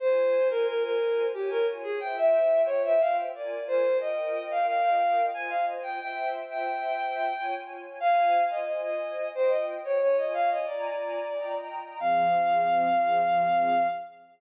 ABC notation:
X:1
M:3/4
L:1/16
Q:1/4=90
K:Fm
V:1 name="Violin"
c3 B B B3 G B z A | g =e3 d e f z =d2 c2 | e3 f f f3 a f z g | g2 z g7 z2 |
f3 e e e3 c e z d | d e f e =d6 z2 | f12 |]
V:2 name="String Ensemble 1"
[Fca]8 [Fda]4 | [Fc=eg]8 [FB=da]4 | [FBeg]8 [Fcea]4 | [Fc=eg]8 [Fda]4 |
[Fca]8 [Fceg]4 | [Fda]4 [F=dab]4 [Fegb]4 | [F,CA]12 |]